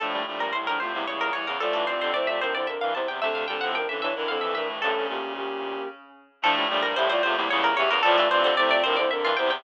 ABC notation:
X:1
M:3/4
L:1/16
Q:1/4=112
K:Dm
V:1 name="Pizzicato Strings"
A2 z B c B c2 ^c B c B | A A c c d e c d e f a g | e f g ^f g e e2 =f e e2 | A8 z4 |
A2 z B c c c2 ^c B c B | A A c c d d c d e F g g |]
V:2 name="Ocarina"
[F,D]2 [F,D]2 [G,E] [F,D] [A,F] [G,E] [G,E]2 [G,E] z | [Fd]2 [Fd]2 [Ec] [Fd] [DB] [Ec] [DB]2 [Ec] z | [CA]2 [CA]2 [DB] [^CA] [E^c] [DB] [=CA]2 [DB] z | [^CA]2 [B,G]2 [B,G]4 z4 |
[F,D]2 [F,D]2 [Ge] [Fd] [A,F] [G,E] [G,E]2 [Ge] z | [Fd]2 [Fd]2 [Ec] [Fd] [DB] [Ec] [DB]2 [Ec] z |]
V:3 name="Clarinet"
[A,,A,]2 [A,,A,] [G,,G,] z [A,,A,] [A,,A,] [B,,B,] [^C,,^C,]2 [E,,E,]2 | [A,,A,]2 [C,C]6 z4 | [D,D]2 [D,D] [C,C] z [D,D] [D,D] [E,E] [F,,F,]2 [A,,A,]2 | [A,,A,] [^C,^C]7 z4 |
[A,,A,]2 [A,,A,] [G,,G,] z [A,,A,] [A,,A,] [B,,B,] [^C,,^C,]2 [E,,E,]2 | [A,,A,]2 [C,C]6 z4 |]
V:4 name="Clarinet"
[A,,F,] [B,,G,] [B,,G,]2 [C,,A,,]2 [E,,C,] [E,,C,] [E,,^C,]3 [E,,C,] | [A,,F,] [G,,E,]2 [F,,D,] [C,A,]2 [A,,F,] [F,,D,] [F,,D,] [G,,E,] [E,,C,]2 | [C,A,]2 [B,,G,] [A,,F,]2 [G,,E,] [G,,E,] [F,,D,] [F,,D,] [G,,E,] [G,,E,] [G,,E,] | [B,,,G,,]2 [D,,B,,]6 z4 |
[A,,F,] [B,,G,] [B,,G,]2 [C,,A,,]2 [E,,C,] [E,,C,] [E,,^C,]3 [E,,C,] | [A,,F,] [G,,E,]2 [F,,D,] [C,A,]2 [A,,F,] [F,,D,] [F,,D,] [G,,E,] [E,,C,]2 |]